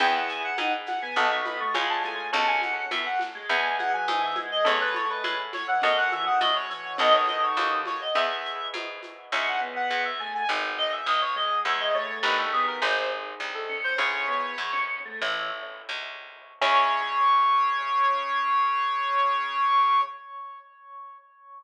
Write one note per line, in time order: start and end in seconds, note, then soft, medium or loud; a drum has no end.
0.00 0.53 E2 loud
0.00 1.14 B3 medium
0.00 1.14 E4 medium
0.00 0.48 E4 medium
0.00 1.14 G#4 medium
0.00 0.14 G5 medium
0.00 crash medium
0.00 low conga medium
0.00 shaker medium
0.15 0.29 F#5 medium
0.29 0.43 G#5 medium
0.29 shaker medium
0.44 0.58 F#5 medium
0.58 1.10 G#2 medium
0.58 0.72 D#4 medium
0.58 0.72 F#5 medium
0.58 high conga medium
0.58 shaker medium
0.86 1.01 F#5 medium
0.86 snare soft
0.86 high conga medium
0.86 shaker medium
1.02 1.16 B3 medium
1.02 1.16 G#5 medium
1.16 1.70 B1 loud
1.16 1.41 B3 medium
1.16 1.74 B3 medium
1.16 1.74 D#4 medium
1.16 1.74 F#4 medium
1.16 1.74 A4 medium
1.16 1.30 A5 medium
1.16 low conga medium
1.16 shaker medium
1.31 1.45 C#6 medium
1.46 1.60 B3 medium
1.46 1.59 B5 medium
1.46 high conga medium
1.46 shaker medium
1.60 1.74 A3 medium
1.60 1.74 C#6 medium
1.74 2.28 C#2 loud
1.74 2.02 G#3 medium
1.74 2.32 C#4 medium
1.74 2.32 F4 medium
1.74 2.32 G#4 medium
1.74 1.89 B5 medium
1.74 high conga medium
1.74 shaker medium
1.89 2.03 A5 medium
2.04 2.29 A3 medium
2.04 2.27 G#5 medium
2.04 high conga medium
2.04 shaker medium
2.33 2.86 C#2 loud
2.33 3.47 C#4 medium
2.33 2.85 C#4 medium
2.33 3.47 F#4 medium
2.33 3.47 A4 medium
2.33 2.47 A5 medium
2.33 low conga medium
2.33 shaker medium
2.47 2.61 G#5 medium
2.62 2.89 F#5 medium
2.62 high conga medium
2.62 shaker medium
2.91 3.44 F#2 medium
2.91 3.05 B3 medium
2.91 3.05 E5 medium
2.91 high conga medium
2.91 shaker medium
3.06 3.20 F#5 medium
3.19 snare medium
3.19 high conga medium
3.19 shaker medium
3.35 3.49 G#3 medium
3.49 4.02 E2 loud
3.49 3.75 G#3 medium
3.49 4.64 B3 medium
3.49 4.64 E4 medium
3.49 4.64 G#4 medium
3.49 3.75 G#5 medium
3.49 low conga medium
3.49 shaker medium
3.79 3.92 G#3 medium
3.79 3.92 F#5 medium
3.79 high conga medium
3.79 shaker medium
3.93 4.07 F#3 medium
3.93 4.07 G#5 medium
4.08 4.60 G#2 medium
4.08 4.35 E3 medium
4.08 4.21 G#5 medium
4.08 high conga medium
4.08 shaker medium
4.22 4.36 E5 medium
4.36 4.64 G#3 medium
4.36 high conga medium
4.36 shaker medium
4.51 4.65 D#5 medium
4.65 5.19 E2 loud
4.65 5.22 A3 medium
4.65 5.79 C#4 medium
4.65 5.79 E4 medium
4.65 5.79 A4 medium
4.65 4.80 C#5 medium
4.65 low conga medium
4.65 shaker medium
4.81 4.94 B4 medium
4.94 5.09 C#5 medium
4.94 high conga medium
4.94 shaker medium
5.10 5.24 B4 medium
5.24 5.77 A2 medium
5.24 5.38 G#3 medium
5.24 5.38 B4 medium
5.24 high conga medium
5.24 shaker medium
5.53 5.67 C#5 medium
5.53 snare soft
5.53 high conga medium
5.53 shaker medium
5.68 5.81 E3 medium
5.68 5.82 F#5 medium
5.82 6.36 F#2 loud
5.82 6.07 F#3 medium
5.82 6.97 C#4 medium
5.82 6.97 F#4 medium
5.82 6.97 A4 medium
5.82 5.96 D#5 medium
5.82 low conga medium
5.82 shaker medium
5.97 6.11 F#5 medium
6.12 6.26 E3 medium
6.12 6.25 E5 medium
6.12 high conga medium
6.12 shaker medium
6.26 6.40 D#3 medium
6.26 6.40 F#5 medium
6.41 6.93 A2 medium
6.41 6.66 C#3 medium
6.41 6.55 D#5 medium
6.41 high conga medium
6.41 shaker medium
6.55 6.69 C#5 medium
6.70 6.96 E3 medium
6.70 6.96 C#5 medium
6.70 shaker medium
6.98 7.51 B1 loud
6.98 7.80 D#3 loud
6.98 8.14 B3 medium
6.98 8.14 D#4 medium
6.98 8.14 F#4 medium
6.98 8.14 A4 medium
6.98 7.13 D#5 medium
6.98 low conga medium
6.98 shaker medium
7.14 7.27 C#5 medium
7.27 7.42 D#5 medium
7.27 high conga medium
7.27 shaker medium
7.43 7.57 C#5 medium
7.56 8.09 D#2 medium
7.56 7.71 C#5 medium
7.56 high conga medium
7.56 shaker medium
7.86 8.00 C#5 medium
7.86 snare soft
7.86 high conga medium
7.86 shaker medium
8.01 8.15 D#5 medium
8.15 8.68 E2 medium
8.15 9.29 B3 medium
8.15 9.29 E4 medium
8.15 9.29 G#4 medium
8.15 8.67 E5 medium
8.15 low conga medium
8.15 shaker medium
8.45 shaker medium
8.74 9.26 G#2 medium
8.74 high conga medium
8.74 shaker medium
9.03 high conga medium
9.03 shaker medium
9.32 9.85 C#2 loud
9.32 9.56 C#4 medium
9.32 10.48 C#4 medium
9.32 10.48 E4 medium
9.32 10.48 G#4 medium
9.32 9.46 E5 medium
9.47 9.60 F#5 medium
9.61 10.10 B3 medium
9.76 9.90 F#5 medium
9.90 10.43 E2 medium
9.90 10.04 F#5 medium
10.05 10.19 E5 medium
10.19 10.43 A3 medium
10.19 10.33 G#5 medium
10.34 10.48 G#5 medium
10.49 11.01 G#1 loud
10.49 11.64 B3 medium
10.49 11.64 D#4 medium
10.49 11.64 G#4 medium
10.78 10.92 D#5 medium
10.92 11.06 E5 medium
11.06 11.59 B1 medium
11.06 11.21 D#5 medium
11.21 11.35 C#5 medium
11.36 11.64 G#3 medium
11.36 11.60 D#5 medium
11.65 12.19 E2 loud
11.65 11.90 G#3 medium
11.65 12.23 C#4 medium
11.65 12.23 E4 medium
11.65 12.23 G#4 medium
11.65 11.79 E5 medium
11.80 11.93 D#5 medium
11.94 12.45 A3 medium
11.94 12.18 C#5 medium
12.23 12.76 G1 loud
12.23 12.80 C#4 medium
12.23 12.80 D#4 medium
12.23 12.80 G4 medium
12.23 12.80 A#4 medium
12.23 12.37 B4 medium
12.38 12.52 A4 medium
12.52 12.79 B3 medium
12.52 12.66 G#4 medium
12.67 12.81 A#4 medium
12.82 13.34 G#1 loud
12.82 13.96 C4 medium
12.82 13.96 D#4 medium
12.82 13.96 G#4 medium
12.82 13.10 C5 medium
13.40 13.92 C2 medium
13.54 13.78 A4 medium
13.69 13.93 C#4 medium
13.84 13.97 C5 medium
13.98 14.52 C#2 loud
13.98 15.19 C#4 medium
13.98 14.26 C#4 medium
13.98 15.19 E4 medium
13.98 15.19 G#4 medium
13.98 14.80 C#5 medium
14.28 14.54 B3 medium
14.58 15.15 E2 medium
14.73 14.99 C#4 medium
15.05 15.21 A3 medium
15.22 15.82 A1 loud
15.22 15.49 E3 medium
15.22 16.59 C#4 medium
15.22 16.59 E4 medium
15.22 16.59 A4 medium
15.89 16.54 C#2 medium
16.61 20.01 C#2 loud
16.61 20.01 C#3 loud
16.61 20.01 C#4 loud
16.61 20.01 E4 loud
16.61 20.01 G#4 loud
16.61 20.01 C#5 loud